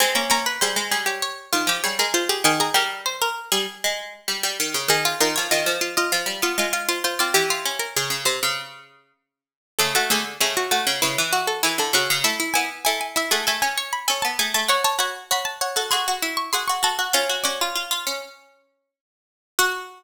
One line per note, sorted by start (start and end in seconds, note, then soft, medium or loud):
0.00 0.16 G#3 medium
0.00 0.15 C4 medium
0.00 0.30 G#5 loud
0.15 0.29 A#3 medium
0.15 0.30 C#4 medium
0.30 0.59 A#3 medium
0.30 0.45 C#4 medium
0.30 0.56 A#5 loud
0.46 0.61 B4 medium
0.61 0.76 G3 medium
0.61 0.87 G#4 loud
0.61 1.03 C5 medium
0.76 0.91 G#3 medium
0.91 1.21 G3 medium
0.91 1.06 G#4 medium
1.06 1.48 G4 medium
1.06 1.22 C#5 medium
1.22 1.72 C#5 medium
1.53 1.68 D#3 medium
1.53 1.67 F4 loud
1.67 1.82 F3 medium
1.67 1.84 G4 loud
1.84 1.99 G3 medium
1.84 1.98 G#4 medium
1.84 1.98 C#5 medium
1.99 2.28 G#3 medium
1.99 2.14 G#4 medium
1.99 2.14 A#4 medium
2.14 2.28 F4 medium
2.14 2.29 C5 medium
2.29 2.44 G4 medium
2.29 2.44 G#4 medium
2.44 2.70 D#3 medium
2.44 2.59 G#4 medium
2.44 2.60 G#5 loud
2.60 2.74 G#4 medium
2.60 2.75 A#5 loud
2.74 3.34 G3 medium
2.74 3.01 A#4 medium
2.74 4.34 G5 loud
3.06 3.20 C5 medium
3.22 3.50 A#4 medium
3.52 3.66 G3 medium
3.52 4.22 G#4 medium
3.84 4.14 G#3 medium
4.28 4.42 G3 medium
4.43 4.58 G3 medium
4.60 4.74 D#3 medium
4.74 4.89 C#3 medium
4.88 5.14 D#3 medium
4.88 5.04 D#4 medium
4.88 5.17 G#4 loud
5.05 5.20 F4 medium
5.20 5.35 D#3 medium
5.20 5.35 F4 medium
5.20 5.48 A#4 loud
5.36 5.52 F3 medium
5.36 5.50 C#5 medium
5.51 5.67 D#3 medium
5.51 5.79 F4 medium
5.51 5.94 D#5 medium
5.66 6.05 F3 medium
5.81 5.96 F4 loud
5.97 6.39 F4 loud
5.97 6.12 D#5 medium
6.12 6.27 F3 medium
6.12 6.65 F5 medium
6.26 6.41 G3 medium
6.42 6.57 B3 medium
6.42 6.58 F4 loud
6.58 7.14 G#3 medium
6.58 6.72 F4 medium
6.73 6.88 F4 loud
6.73 6.88 F5 medium
6.89 7.03 F4 loud
6.89 7.03 C5 medium
7.04 7.19 F4 medium
7.04 7.19 C5 medium
7.19 7.35 C4 medium
7.19 7.34 F4 medium
7.19 7.34 D5 medium
7.34 7.88 E3 medium
7.34 7.79 G4 loud
7.34 7.49 G4 medium
7.50 7.65 F4 medium
7.65 8.73 C#4 medium
7.79 7.94 A#4 medium
7.96 8.10 C#3 medium
7.96 8.21 G#4 loud
8.10 8.25 C#3 medium
8.25 8.40 C3 medium
8.25 8.82 C5 medium
8.43 9.12 C#3 medium
9.79 9.94 C#3 medium
9.79 9.94 A3 medium
9.79 9.93 A4 loud
9.95 10.09 A3 medium
9.95 10.10 F#4 loud
10.10 10.37 D3 medium
10.10 10.25 A3 medium
10.10 10.38 G#4 loud
10.40 10.84 C#3 medium
10.40 10.67 A3 medium
10.40 10.56 G#4 loud
10.57 10.71 F#4 loud
10.71 10.86 A3 medium
10.71 11.00 F#4 loud
10.87 11.01 C#3 medium
10.87 11.01 C#4 medium
11.02 11.17 C#3 medium
11.02 11.30 E4 medium
11.02 11.45 B4 medium
11.18 11.62 E3 medium
11.33 11.62 F#4 medium
11.47 11.62 A4 medium
11.63 11.79 E3 medium
11.63 11.92 E4 medium
11.63 11.78 G#4 medium
11.78 11.93 D3 medium
11.78 11.94 A4 medium
11.93 12.08 C#3 medium
11.93 12.21 C#4 medium
11.93 12.19 F#4 loud
12.10 12.25 C#3 medium
12.24 12.39 A3 medium
12.24 12.39 E4 medium
12.24 12.52 E5 loud
12.40 12.54 E4 medium
12.54 12.84 B3 medium
12.54 12.70 E4 medium
12.54 12.80 G#5 medium
12.85 13.24 A3 medium
12.85 13.15 E4 medium
12.85 12.99 G#5 medium
13.01 13.15 G#5 medium
13.16 13.30 E4 medium
13.16 13.32 E5 loud
13.31 13.46 A3 medium
13.31 13.46 G#4 medium
13.31 13.46 F#5 medium
13.47 13.62 A3 medium
13.47 13.76 A4 medium
13.47 13.61 G#5 loud
13.62 14.03 C#4 medium
13.62 13.90 G#5 medium
13.78 14.02 C#5 medium
13.93 14.07 B5 loud
14.08 14.24 C#4 medium
14.08 14.37 A4 medium
14.08 14.22 G#5 medium
14.22 14.39 B3 medium
14.22 14.37 A5 medium
14.39 14.54 A3 medium
14.39 14.67 G#4 medium
14.39 14.54 G#5 loud
14.54 14.69 A3 medium
14.54 14.69 A5 loud
14.68 14.83 F#4 medium
14.68 14.84 C#5 loud
14.68 14.85 C#6 loud
14.84 14.99 C#5 medium
14.84 14.99 A5 loud
14.99 15.24 F#4 medium
14.99 15.14 C#5 medium
14.99 15.26 B5 medium
15.31 15.68 F#4 medium
15.31 15.56 C#5 medium
15.31 15.47 B5 medium
15.45 15.60 A5 medium
15.61 15.76 C#5 medium
15.61 15.87 F#5 medium
15.76 15.91 F#4 medium
15.76 15.91 A4 medium
15.91 16.07 F#4 medium
15.91 16.21 G#4 medium
15.91 16.32 C6 medium
16.08 16.51 F#4 medium
16.22 16.50 E4 medium
16.37 16.52 C#6 loud
16.53 16.69 F#4 medium
16.53 16.80 G#4 medium
16.53 16.67 C6 loud
16.68 16.82 F#4 medium
16.68 16.82 C#6 medium
16.83 16.97 F#4 medium
16.83 17.10 A4 medium
16.83 17.08 A5 medium
16.99 17.13 F#4 medium
17.13 17.44 C#4 medium
17.13 17.28 F4 medium
17.13 17.38 F5 loud
17.29 17.44 F#4 medium
17.44 18.30 C#4 medium
17.44 17.59 F#4 medium
17.44 18.31 D5 loud
17.61 17.75 F4 medium
17.76 17.90 F4 medium
17.91 18.05 F4 medium
18.07 18.90 C#4 medium
19.59 20.03 F#4 loud
19.59 20.03 F#5 loud